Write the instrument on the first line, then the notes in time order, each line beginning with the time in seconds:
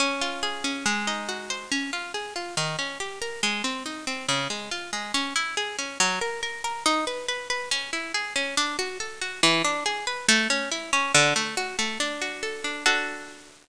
orchestral harp
0.00 C#4
0.21 F4
0.43 G#4
0.64 C#4
0.86 G#3
1.07 D#4
1.29 F#4
1.50 C5
1.72 C#4
1.93 F4
2.14 G#4
2.36 F4
2.57 D#3
2.79 C#4
3.00 G4
3.22 A#4
3.43 G#3
3.64 C4
3.86 D#4
4.07 C4
4.28 C#3
4.50 G#3
4.71 F4
4.93 G#3
5.14 C#4
5.36 E4
5.57 G#4
5.78 C#4
6.00 F#3
6.21 A#4
6.43 A#4
6.64 A#4
6.86 D#4
7.07 B4
7.28 B4
7.50 B4
7.71 C#4
7.93 E4
8.14 G#4
8.36 C#4
8.57 D4
8.79 F#4
9.00 A4
9.21 F#4
9.43 E3
9.64 D4
9.86 G#4
10.07 B4
10.28 A3
10.50 C#4
10.71 E4
10.93 C#4
11.14 D3
11.36 A3
11.57 F#4
11.79 A3
12.00 D4
12.22 F#4
12.43 A4
12.64 D4
12.86 D4 F#4 A4